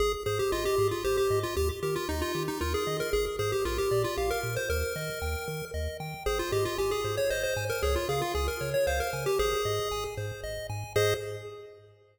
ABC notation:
X:1
M:3/4
L:1/16
Q:1/4=115
K:Ab
V:1 name="Lead 1 (square)"
A z A G F G2 F G G2 F | G z G F E F2 E F A2 B | A z A G F G2 F G B2 c | B8 z4 |
A F G F G A2 d c c2 B | A F A F A B2 d c B2 G | A6 z6 | A4 z8 |]
V:2 name="Lead 1 (square)"
A2 c2 e2 A2 c2 e2 | G2 B2 e2 G2 B2 e2 | A2 c2 B2 =d2 f2 B2 | B2 e2 g2 B2 e2 g2 |
c2 e2 a2 c2 e2 a2 | d2 f2 a2 d2 f2 a2 | c2 e2 a2 c2 e2 a2 | [Ace]4 z8 |]
V:3 name="Synth Bass 1" clef=bass
A,,,2 A,,2 A,,,2 A,,2 A,,,2 A,,2 | E,,2 E,2 E,,2 E,2 E,,2 E,2 | A,,,2 A,,2 B,,,2 B,,2 B,,,2 B,,2 | E,,2 E,2 E,,2 E,2 E,,2 E,2 |
A,,,2 A,,2 A,,,2 A,,2 A,,,2 A,,2 | D,,2 D,2 D,,2 D,2 D,,2 D,2 | A,,,2 A,,2 A,,,2 A,,2 A,,,2 A,,2 | A,,4 z8 |]